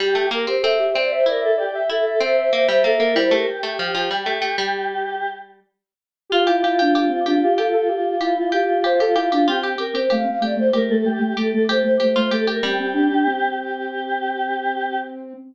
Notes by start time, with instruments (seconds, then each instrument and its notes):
0.00 pizzicato strings G3, choir aahs G4, ocarina G4
0.15 pizzicato strings A3
0.31 pizzicato strings A#3, choir aahs A#4
0.47 pizzicato strings C4, ocarina G4, choir aahs C5
0.62 pizzicato strings C4, ocarina A4, choir aahs E5
0.79 ocarina G4
0.94 pizzicato strings C4, ocarina C5, choir aahs D5
1.11 choir aahs C5, ocarina E5
1.26 pizzicato strings E4, choir aahs A#4, ocarina D5
1.41 choir aahs A4, ocarina E5
1.57 choir aahs G4, ocarina D5
1.74 ocarina E5
1.90 pizzicato strings E4, choir aahs A4, ocarina E5
2.05 choir aahs A4, ocarina E5
2.20 pizzicato strings C4, choir aahs C5, ocarina E5
2.37 choir aahs C5, ocarina E5
2.53 pizzicato strings A#3, ocarina E5
2.68 pizzicato strings G3, choir aahs C5, ocarina E5
2.84 pizzicato strings A#3, choir aahs A4, ocarina E5
3.00 pizzicato strings A#3, choir aahs A#4
3.15 pizzicato strings G3, ocarina E4, choir aahs C5
3.31 pizzicato strings A3, ocarina G4, choir aahs A#4
3.47 choir aahs G4
3.63 pizzicato strings A3
3.79 pizzicato strings F3
3.94 pizzicato strings F3
4.11 pizzicato strings G3
4.26 pizzicato strings A3
4.42 pizzicato strings A3
4.58 pizzicato strings G3
6.30 choir aahs F4, pizzicato strings F4, ocarina G4
6.47 ocarina E4, pizzicato strings G4
6.62 ocarina E4, choir aahs F4, pizzicato strings G4
6.79 ocarina D4, choir aahs F4, pizzicato strings G4
6.95 choir aahs F4, pizzicato strings G4
7.09 ocarina C4
7.26 ocarina D4, choir aahs F4, pizzicato strings G4
7.42 choir aahs F4, ocarina G4
7.58 choir aahs F4, pizzicato strings G4, ocarina A4
7.73 choir aahs F4, ocarina A4
7.88 choir aahs F4, ocarina G4
8.20 ocarina E4, choir aahs F4, pizzicato strings G4
8.36 ocarina E4, choir aahs F4
8.52 choir aahs F4, pizzicato strings G4, ocarina G4
8.68 choir aahs F4
8.84 pizzicato strings G4, ocarina C5
9.00 choir aahs F4, pizzicato strings G4, ocarina A4
9.15 ocarina E4, choir aahs F4, pizzicato strings G4
9.31 ocarina D4, choir aahs F4, pizzicato strings G4
9.47 ocarina C4, pizzicato strings F4, choir aahs G4
9.63 pizzicato strings G4
9.78 pizzicato strings G4, choir aahs A#4
9.94 ocarina C4, pizzicato strings G4, choir aahs C5
10.10 ocarina A3, pizzicato strings G4, choir aahs F5
10.24 ocarina C4
10.41 ocarina A3, pizzicato strings G4, choir aahs D5
10.56 ocarina A3, choir aahs C5
10.73 ocarina A3, pizzicato strings G4, choir aahs A#4
10.90 ocarina A3, choir aahs A4
11.05 ocarina A3, choir aahs G4
11.19 ocarina A3
11.37 ocarina A3, pizzicato strings G4, choir aahs A4
11.53 ocarina A3, choir aahs A4
11.68 ocarina A3, pizzicato strings G4, choir aahs C5
11.83 ocarina A3, choir aahs C5
12.00 ocarina A3, pizzicato strings G4
12.16 ocarina A3, pizzicato strings F4, choir aahs C5
12.31 ocarina A3, pizzicato strings G4, choir aahs A4
12.47 pizzicato strings G4, choir aahs A#4
12.63 pizzicato strings G3, ocarina C4, choir aahs G4
12.80 ocarina C4
12.94 ocarina D4
13.10 ocarina D4
13.26 ocarina C4
13.58 choir aahs G4